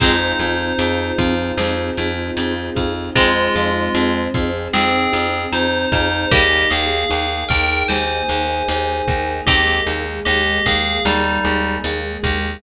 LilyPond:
<<
  \new Staff \with { instrumentName = "Tubular Bells" } { \time 4/4 \key f \minor \tempo 4 = 76 <ees' c''>1 | <aes f'>4. r8 <c' aes'>4 <ees' c''>8 <ees' c''>8 | <g' ees''>8 <aes' f''>4 <bes' g''>8 <c'' aes''>2 | <g' ees''>8 r8 <g' ees''>8 <aes' f''>8 <g ees'>4 r4 | }
  \new Staff \with { instrumentName = "Pizzicato Strings" } { \time 4/4 \key f \minor <aes c'>1 | <aes c'>1 | <g bes>1 | <c' ees'>2~ <c' ees'>8 r4. | }
  \new Staff \with { instrumentName = "Vibraphone" } { \time 4/4 \key f \minor <c' ees' f' aes'>8 <c' ees' f' aes'>8 <c' ees' f' aes'>8 <c' ees' f' aes'>8 <c' ees' f' aes'>8 <c' ees' f' aes'>8 <c' ees' f' aes'>8 <c' ees' f' aes'>8 | <c' ees' f' aes'>8 <c' ees' f' aes'>8 <c' ees' f' aes'>8 <c' ees' f' aes'>8 <c' ees' f' aes'>8 <c' ees' f' aes'>8 <c' ees' f' aes'>8 <c' ees' f' aes'>8 | <bes ees' aes'>8 <bes ees' aes'>8 <bes ees' aes'>8 <bes ees' aes'>8 <bes ees' aes'>8 <bes ees' aes'>8 <bes ees' aes'>8 <bes ees' aes'>8 | <bes ees' aes'>8 <bes ees' aes'>8 <bes ees' aes'>8 <bes ees' aes'>8 <bes ees' aes'>8 <bes ees' aes'>8 <bes ees' aes'>8 <bes ees' aes'>8 | }
  \new Staff \with { instrumentName = "Electric Bass (finger)" } { \clef bass \time 4/4 \key f \minor f,8 f,8 f,8 f,8 f,8 f,8 f,8 f,8 | f,8 f,8 f,8 f,8 f,8 f,8 f,8 f,8 | ees,8 ees,8 ees,8 ees,8 ees,8 ees,8 ees,8 ees,8 | ees,8 ees,8 ees,8 ees,8 ees,8 ees,8 ees,8 ees,8 | }
  \new Staff \with { instrumentName = "String Ensemble 1" } { \time 4/4 \key f \minor <c' ees' f' aes'>1 | <c' ees' aes' c''>1 | <bes ees' aes'>1 | <aes bes aes'>1 | }
  \new DrumStaff \with { instrumentName = "Drums" } \drummode { \time 4/4 <cymc bd>8 hh8 hh8 <hh bd>8 sn8 hh8 hh8 <hh bd>8 | <hh bd>8 hh8 hh8 <hh bd>8 sn8 hh8 hh8 <hh bd>8 | <hh bd>8 hh8 hh8 <hh bd>8 sn8 hh8 hh8 <hh bd>8 | <hh bd>8 hh8 hh8 <hh bd>8 sn8 hh8 hh8 <hh bd>8 | }
>>